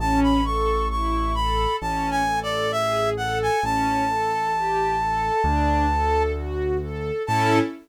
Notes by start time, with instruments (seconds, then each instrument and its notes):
0.00 acoustic grand piano A1, string ensemble 1 C#4, clarinet A5
0.23 clarinet B5
0.45 string ensemble 1 A4, clarinet C#6
0.91 string ensemble 1 E4, clarinet C#6
1.35 string ensemble 1 A4, clarinet B5
1.81 acoustic grand piano A1, string ensemble 1 C#4, clarinet A5
2.11 clarinet G#5
2.27 string ensemble 1 A4
2.43 clarinet D5
2.72 string ensemble 1 G#4, clarinet E5
3.17 string ensemble 1 A4, clarinet F#5
3.42 clarinet G#5
3.63 acoustic grand piano A1, string ensemble 1 C#4, clarinet A5
4.09 string ensemble 1 A4
4.54 string ensemble 1 G4
5.00 string ensemble 1 A4
5.44 acoustic grand piano D2, string ensemble 1 D4
5.91 string ensemble 1 A4
6.36 string ensemble 1 F#4
6.82 string ensemble 1 A4
7.27 acoustic grand piano A2, string ensemble 1 C#4 E4 A4, clarinet A5